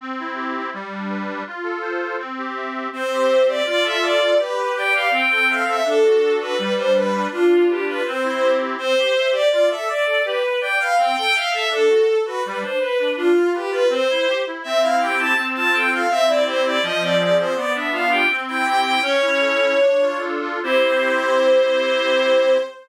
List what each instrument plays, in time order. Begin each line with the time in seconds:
0.01 accordion C4
0.19 accordion E4
0.35 accordion G4
0.56 accordion E4
0.73 accordion G3
0.92 accordion D4
1.09 accordion B4
1.27 accordion D4
1.47 accordion F4
1.63 accordion A4
1.82 accordion C5
2.02 accordion A4
2.19 accordion C4
2.38 accordion G4
2.55 accordion E5
2.73 accordion G4
2.93 accordion C4, violin C5
3.11 accordion G4
3.28 accordion E5
3.48 accordion G4, violin D5
3.65 accordion F4, violin D5
3.82 accordion A4, violin E5
4.02 accordion D5, violin D5
4.21 accordion A4
4.39 accordion G4, violin B4
4.57 accordion B4
4.76 accordion D5, violin G5
4.93 accordion B4, violin F5
5.11 accordion C4, violin G5
5.30 accordion A4, violin G5
5.48 accordion E5, violin F5
5.66 accordion A4, violin E5
5.85 accordion D4, violin A4
6.04 accordion F#4
6.24 accordion A4
6.40 accordion F#4, violin B4
6.58 accordion G3, violin B4
6.77 accordion D4, violin C5
6.95 accordion B4, violin B4
7.13 accordion D4
7.32 accordion D4, violin F4
7.49 accordion F4
7.68 violin G4, accordion B4
7.87 accordion F4, violin B4
8.05 accordion C4, violin C5
8.23 accordion E4
8.43 accordion G4
8.60 accordion E4
8.77 accordion C4, violin C5
8.97 accordion G4
9.16 accordion E5
9.31 accordion G4, violin D5
9.51 accordion F4, violin D5
9.69 accordion A4, violin E5
9.87 accordion D5, violin D5
10.05 accordion A4
10.25 accordion G4, violin B4
10.42 accordion B4
10.61 accordion D5, violin G5
10.79 accordion B4, violin F5
10.97 accordion C4, violin G5
11.16 accordion A4, violin G5
11.34 accordion E5, violin F5
11.53 accordion A4, violin E5
11.70 accordion D4, violin A4
11.89 accordion F#4
12.08 accordion A4
12.25 accordion F#4, violin B4
12.44 accordion G3, violin B4
12.61 accordion D4, violin C5
12.79 accordion B4, violin B4
12.99 accordion D4
13.17 accordion D4, violin F4
13.36 accordion F4
13.53 violin G4, accordion B4
13.70 accordion F4, violin B4
13.89 accordion C4, violin C5
14.09 accordion E4
14.27 accordion G4
14.46 accordion E4
14.63 accordion C4, violin E5
14.81 accordion E4, violin F5
15.00 accordion G4, violin G5
15.19 accordion E4, violin A5
15.37 accordion C4
15.55 accordion F4, violin A5
15.73 accordion A4, violin G5
15.91 accordion F4, violin F5
16.10 accordion C4, violin E5
16.27 accordion E4, violin D5
16.46 accordion G4, violin C5
16.64 accordion E4, violin D5
16.83 accordion F3, violin D#5
17.01 accordion C4, violin D5
17.19 accordion G#4, violin D5
17.38 accordion C4, violin C5
17.55 accordion B3, violin D5
17.74 accordion D4, violin E5
17.92 accordion F4, violin F5
18.11 accordion G4, violin G5
18.30 accordion C4
18.47 accordion E4, violin G5
18.65 accordion G4, violin G5
18.84 accordion E4, violin G5
19.02 accordion C#4, violin C#5
19.21 accordion E4
19.40 accordion A4
19.61 accordion E4
19.79 accordion D4
20.01 accordion F4
20.19 accordion A4
20.41 accordion F4
20.63 accordion C4 E4 G4, violin C5